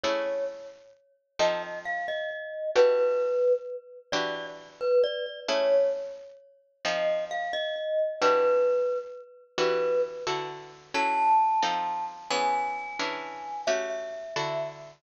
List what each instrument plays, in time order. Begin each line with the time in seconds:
0.04 acoustic guitar (steel) A3 C#4 E4 G#4, glockenspiel C#5
1.39 acoustic guitar (steel) F3 C4 D#4 A4, glockenspiel D#5
1.85 glockenspiel F5
2.08 glockenspiel D#5
2.75 acoustic guitar (steel) E3 D4 F#4 G4, glockenspiel B4
4.12 acoustic guitar (steel) E3 D4 F#4 G4, glockenspiel D5
4.81 glockenspiel B4
5.04 glockenspiel D5
5.48 acoustic guitar (steel) A3 C#4 E4 G#4, glockenspiel C#5
6.85 acoustic guitar (steel) F3 C4 D#4 A4, glockenspiel D#5
7.31 glockenspiel F5
7.53 glockenspiel D#5
8.21 acoustic guitar (steel) E3 D4 F#4 G4, glockenspiel B4
9.58 acoustic guitar (steel) E3 D4 F#4 G4, glockenspiel B4
10.27 acoustic guitar (steel) D3 E4 F#4 A4
10.94 acoustic guitar (steel) F#3 C#4 E4 A4, glockenspiel A5
11.62 acoustic guitar (steel) F3 C4 D#4 A4
12.30 acoustic guitar (steel) E3 B3 C#4 G#4, glockenspiel G#5
12.99 acoustic guitar (steel) E3 C#4 D4 G#4
13.67 acoustic guitar (steel) A3 C#4 F#4 G4, glockenspiel E5
14.36 acoustic guitar (steel) D3 E4 F#4 A4